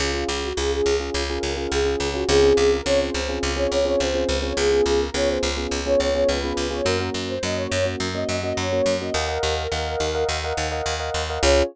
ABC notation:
X:1
M:4/4
L:1/16
Q:1/4=105
K:Db
V:1 name="Ocarina"
F2 F G A A2 z2 B B B A3 G | A2 A B d c2 z2 d d d c3 d | A2 A B d c2 z2 d d d _c3 d | B2 B c e d2 z2 e e e d3 e |
B10 z6 | d4 z12 |]
V:2 name="Electric Piano 1"
[DFA] [DFA]3 [DFA]3 [DFA]2 [DFA]2 [DFA]2 [DFA]2 [DFA] | [CDFA] [CDFA]3 [CDFA]3 [CDFA]2 [CDFA]2 [CDFA]2 [CDFA]2 [CDFA] | [_CDFA] [CDFA]3 [CDFA]3 [CDFA]2 [CDFA]2 [CDFA]2 [CDFA]2 [CDFA] | [B,DG] [B,DG]3 [B,DG]3 [B,DG]2 [B,DG]2 [B,DG]2 [B,DG]2 [B,DG] |
[Befg] [Befg]3 [Befg]3 [Befg]2 [Befg]2 [Befg]2 [Befg]2 [Befg] | [DFA]4 z12 |]
V:3 name="Electric Bass (finger)" clef=bass
D,,2 D,,2 D,,2 D,,2 D,,2 D,,2 D,,2 D,,2 | D,,2 D,,2 D,,2 D,,2 D,,2 D,,2 D,,2 D,,2 | D,,2 D,,2 D,,2 D,,2 D,,2 D,,2 D,,2 D,,2 | G,,2 G,,2 G,,2 G,,2 G,,2 G,,2 G,,2 G,,2 |
E,,2 E,,2 E,,2 E,,2 E,,2 E,,2 E,,2 E,,2 | D,,4 z12 |]